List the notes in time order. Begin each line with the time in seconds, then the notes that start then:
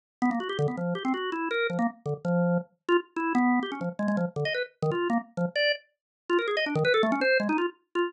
0.22 B3
0.31 A#3
0.40 F#4
0.49 G4
0.59 D3
0.68 B3
0.77 F3
0.95 G4
1.05 C4
1.14 F#4
1.32 E4
1.51 A#4
1.70 F3
1.79 A#3
2.06 D3
2.25 F3
2.89 F4
3.16 E4
3.35 B3
3.63 G4
3.72 C#4
3.81 F3
3.99 G#3
4.08 G#3
4.17 F3
4.36 D3
4.45 D#5
4.54 B4
4.82 D#3
4.91 F4
5.10 A#3
5.37 F3
5.56 D5
6.30 F4
6.39 A#4
6.48 G#4
6.57 D#5
6.66 D4
6.75 D#3
6.85 B4
6.94 A4
7.03 A3
7.12 C#4
7.21 C5
7.40 G#3
7.49 D#4
7.58 F4
7.95 F4